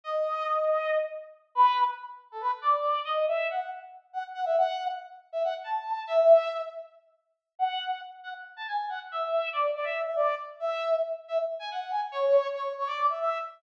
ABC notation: X:1
M:7/8
L:1/16
Q:1/4=139
K:Edor
V:1 name="Brass Section"
^d10 z4 | [K:Bdor] B3 z4 A B z d4 | ^d2 e2 f2 z4 f z f e | f3 z4 e f z a4 |
e6 z8 | f4 z2 f z2 a g2 f z | e4 d2 d e2 e d2 z2 | e4 z2 e z2 g f2 g z |
c4 c2 c d2 e e2 z2 |]